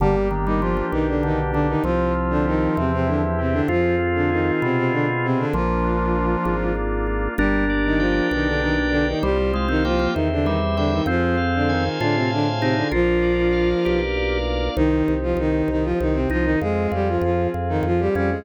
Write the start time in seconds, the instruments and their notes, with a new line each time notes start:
0.00 drawbar organ G1 D3 A#3, violin G3 G4, pad 5 (bowed) A#3 D4 G4
0.31 drawbar organ D#3 D4
0.45 violin D#3 D#4, drawbar organ G3
0.61 violin F3 F4, drawbar organ F3 G4
0.77 drawbar organ F3
0.92 drawbar organ B1 A#3, violin D#3 D#4
1.08 violin D3 D4
1.23 drawbar organ D3 D4, violin D#3 D#4
1.52 violin D3 D4, drawbar organ D3 G4
1.68 violin D#3 D#4
1.84 drawbar organ C2 F3 C4, violin F3 F4, pad 5 (bowed) C4 F4 G4
2.15 drawbar organ F4
2.30 violin D3 D4
2.46 violin D#3 D#4, drawbar organ G4
2.76 drawbar organ E2 C4, violin C3 C4, pad 5 (bowed) C4 E4 G4
2.93 violin C3 C4
3.07 violin D3 D4, drawbar organ E4
3.39 violin C3 C4, drawbar organ G4
3.52 violin D3 D4
3.68 drawbar organ F2 C4 F4, violin F3 F4, pad 5 (bowed) C4 F4 G#4
3.99 drawbar organ F4
4.15 violin D3 D4
4.30 violin D#3 D#4, drawbar organ G#4
4.62 drawbar organ B2 C4, violin C3 C4
4.77 violin C3 C4
4.92 violin D3 D4, drawbar organ F4
5.23 violin C3 C4, drawbar organ G#4
5.38 violin D3 D4
5.53 drawbar organ A#1 F3 A#3, violin F3 F4, pad 5 (bowed) A#3 D4 F4
5.84 drawbar organ D4
6.16 drawbar organ F4
6.45 drawbar organ G#1 A#3
6.75 drawbar organ D4
7.07 drawbar organ F4
7.38 drawbar organ G1 D4 A#4, violin G3 G4, pad 5 (bowed) A#3 D4 G4
7.70 drawbar organ D5
7.86 violin D#3 D#4
7.99 violin F3 F4, drawbar organ G5
8.31 drawbar organ B1 A#4, violin D#3 D#4
8.47 violin D3 D4
8.61 violin D#3 D#4, drawbar organ D5
8.90 violin D3 D4, drawbar organ G5
9.08 violin D#3 D#4
9.23 drawbar organ C2 G3 C5, violin G3 G4, pad 5 (bowed) C4 F4 G4
9.54 drawbar organ G#3 F5
9.68 violin D#3 D#4, drawbar organ C4
9.85 violin F3 F4, drawbar organ A#3 G5
9.99 drawbar organ A#3
10.13 drawbar organ E2 C5, violin D#3 D#4, pad 5 (bowed) C4 E4 G4
10.32 violin D3 D4
10.44 violin D#3 D#4, drawbar organ G3 E5
10.77 violin D3 D4, drawbar organ G3 G5
10.92 violin D#3 D#4
11.06 drawbar organ F2 C4 C5, violin F3 F4, pad 5 (bowed) C4 F4 G#4
11.37 drawbar organ F5
11.55 violin D3 D4
11.67 violin D#3 D#4, drawbar organ G#5
12.00 drawbar organ A2 F4 C5, violin D3 D4
12.15 violin C3 C4
12.30 violin D3 D4, drawbar organ F5
12.60 violin C3 C4, drawbar organ D#4 G#5
12.76 violin D3 D4
12.91 drawbar organ A#1 F4 A#4, violin F3 F4, pad 5 (bowed) A#3 D4 F4
13.22 drawbar organ D5
13.52 drawbar organ F5
13.83 drawbar organ B1 G4 A#4
14.16 drawbar organ D5
14.46 drawbar organ F5
14.76 drawbar organ C2, violin D#3 D#4, pad 5 (bowed) C4 D#4 G4
15.08 drawbar organ C2
15.23 violin F3 F4
15.37 drawbar organ C2, violin D#3 D#4
15.68 drawbar organ C2, violin D#3 D#4
15.84 violin F3 F4
16.00 drawbar organ C2, violin D#3 D#4
16.13 violin C3 C4
16.30 drawbar organ C2 D#4, violin F3 F4
16.44 violin D#3 D#4
16.61 drawbar organ F2, violin G#3 G#4, pad 5 (bowed) C4 F4 G#4
16.92 drawbar organ F2, violin G3 G4
17.08 violin F3 F4
17.21 drawbar organ F2, violin F3 F4
17.54 drawbar organ F2
17.69 violin D#3 D#4
17.83 drawbar organ F2, violin F3 F4
18.00 violin G3 G4
18.15 drawbar organ F2 C#4, violin G3 G4
18.31 violin G#3 G#4